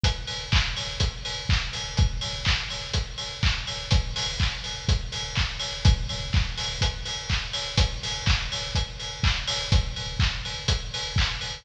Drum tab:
HH |xo-oxo-o|xo-oxo-o|xo-oxo-o|xo-oxo-o|
CP |--x---x-|--x---x-|--x---x-|--x---x-|
BD |o-o-o-o-|o-o-o-o-|o-o-o-o-|o-o-o-o-|

HH |xo-oxo-o|xo-oxo-o|
CP |--x---x-|--x---x-|
BD |o-o-o-o-|o-o-o-o-|